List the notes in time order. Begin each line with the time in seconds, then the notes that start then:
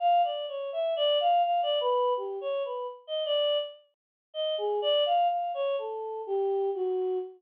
0.00 F5
0.24 D5
0.48 C#5
0.72 E5
0.96 D5
1.20 F5
1.44 F5
1.63 D5
1.81 B4
2.17 G4
2.41 C#5
2.65 B4
3.07 D#5
3.25 D5
4.34 D#5
4.58 G#4
4.82 D5
5.06 F5
5.30 F5
5.54 C#5
5.78 A4
6.27 G4
6.75 F#4